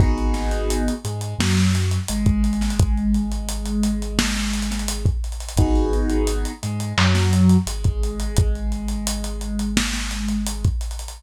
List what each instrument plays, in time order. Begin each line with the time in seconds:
0.00 synth bass 2 G#1, acoustic grand piano B3 D#4 F#4 G#4, kick, closed hi-hat
0.18 closed hi-hat
0.34 snare, closed hi-hat
0.51 closed hi-hat
0.70 closed hi-hat
0.88 closed hi-hat
1.05 synth bass 2 G#2, acoustic grand piano G#3, closed hi-hat
1.21 closed hi-hat
1.39 synth bass 2 F#2, acoustic grand piano F#3, snare
1.57 snare, closed hi-hat
1.75 closed hi-hat
1.91 closed hi-hat
2.08 synth bass 2 G#1, acoustic grand piano G#3, closed hi-hat
2.26 kick, closed hi-hat
2.44 closed hi-hat
2.53 closed hi-hat
2.61 snare, closed hi-hat
2.70 closed hi-hat
2.80 kick, closed hi-hat
2.97 closed hi-hat
3.14 closed hi-hat
3.32 closed hi-hat
3.49 closed hi-hat
3.66 closed hi-hat
3.83 closed hi-hat
4.02 closed hi-hat
4.19 snare
4.35 snare, closed hi-hat
4.53 closed hi-hat
4.62 closed hi-hat
4.71 snare, closed hi-hat
4.79 closed hi-hat
4.88 closed hi-hat
5.06 kick, closed hi-hat
5.24 closed hi-hat
5.32 closed hi-hat
5.40 closed hi-hat
5.49 closed hi-hat
5.57 synth bass 2 G#1, acoustic grand piano B3 D#4 F#4 G#4, kick, closed hi-hat
5.75 closed hi-hat
5.93 closed hi-hat
6.10 closed hi-hat
6.27 closed hi-hat
6.45 closed hi-hat
6.63 synth bass 2 G#2, acoustic grand piano G#3, closed hi-hat
6.80 closed hi-hat
6.97 synth bass 2 F#2, acoustic grand piano F#3, clap
7.15 snare, closed hi-hat
7.33 closed hi-hat
7.49 closed hi-hat
7.67 synth bass 2 G#1, acoustic grand piano G#3, closed hi-hat
7.84 kick, closed hi-hat
8.03 closed hi-hat
8.20 closed hi-hat
8.36 kick, closed hi-hat
8.55 closed hi-hat
8.72 closed hi-hat
8.88 closed hi-hat
9.07 closed hi-hat
9.24 closed hi-hat
9.41 closed hi-hat
9.59 closed hi-hat
9.77 snare
9.93 snare, closed hi-hat
10.11 closed hi-hat
10.28 closed hi-hat
10.47 closed hi-hat
10.65 kick, closed hi-hat
10.81 closed hi-hat
10.91 closed hi-hat
10.99 closed hi-hat
11.08 closed hi-hat